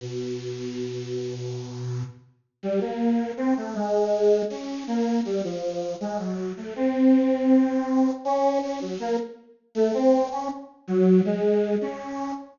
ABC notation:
X:1
M:3/4
L:1/16
Q:1/4=80
K:none
V:1 name="Lead 1 (square)"
B,,12 | z2 G, _B,3 C A, _A,4 | _D2 _B,2 G, F,3 _A, _G,2 =A, | C8 _D2 D _G, |
_B, z3 A, C2 _D z2 _G,2 | _A,3 _D3 z6 |]